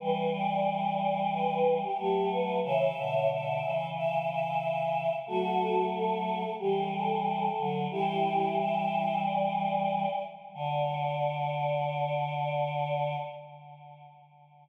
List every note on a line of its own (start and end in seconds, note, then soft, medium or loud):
0.00 1.83 E3 medium
0.00 1.83 G3 loud
0.00 0.31 B4 loud
0.33 0.93 D5 loud
0.99 1.29 D5 loud
1.32 1.74 B4 loud
1.82 1.97 G4 medium
1.98 2.60 F#3 medium
1.98 2.60 A3 medium
1.98 2.29 G4 loud
2.31 2.60 B4 loud
2.63 2.91 C#3 medium
2.63 2.91 E3 loud
2.63 3.28 C#5 loud
2.63 3.28 E5 loud
2.97 3.61 B2 medium
2.97 3.61 D3 medium
3.29 3.87 E5 loud
3.62 5.11 C#3 medium
3.62 5.11 E3 medium
3.95 4.27 E5 loud
4.29 5.14 E5 loud
5.27 6.43 F#3 medium
5.27 6.43 A3 medium
5.27 5.85 F#4 loud
5.27 5.85 A4 loud
5.94 6.53 A4 loud
6.59 7.49 E3 medium
6.59 7.49 G3 medium
6.59 6.89 G4 medium
6.92 7.76 A4 loud
7.58 7.87 D3 medium
7.58 7.87 F#3 medium
7.91 10.06 E3 medium
7.91 10.06 G3 loud
7.91 8.54 E4 loud
7.91 8.54 G4 loud
8.57 9.22 E5 loud
9.23 10.20 D5 medium
10.54 13.16 D3 loud
10.54 13.16 D5 loud